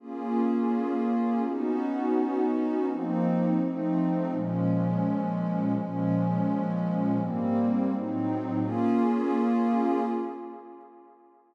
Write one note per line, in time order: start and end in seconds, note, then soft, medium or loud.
0.00 1.43 A#3 medium
0.00 1.43 C#4 medium
0.00 1.43 F4 medium
0.00 1.43 G#4 medium
1.44 2.86 B3 medium
1.44 2.86 C#4 medium
1.44 2.86 D#4 medium
1.44 2.86 F#4 medium
2.87 3.59 F3 medium
2.87 3.59 A#3 medium
2.87 3.59 C4 medium
2.87 3.59 D#4 medium
3.60 4.31 F3 medium
3.60 4.31 A3 medium
3.60 4.31 C4 medium
3.60 4.31 D#4 medium
4.31 5.74 A#2 medium
4.31 5.74 F3 medium
4.31 5.74 G#3 medium
4.31 5.74 C#4 medium
5.75 7.17 A#2 medium
5.75 7.17 F3 medium
5.75 7.17 G#3 medium
5.75 7.17 C#4 medium
7.18 7.90 G#2 medium
7.18 7.90 G3 medium
7.18 7.90 A#3 medium
7.18 7.90 C4 medium
7.90 8.62 A2 medium
7.90 8.62 F#3 medium
7.90 8.62 C4 medium
7.90 8.62 D#4 medium
8.62 10.01 A#3 loud
8.62 10.01 C#4 loud
8.62 10.01 F4 loud
8.62 10.01 G#4 loud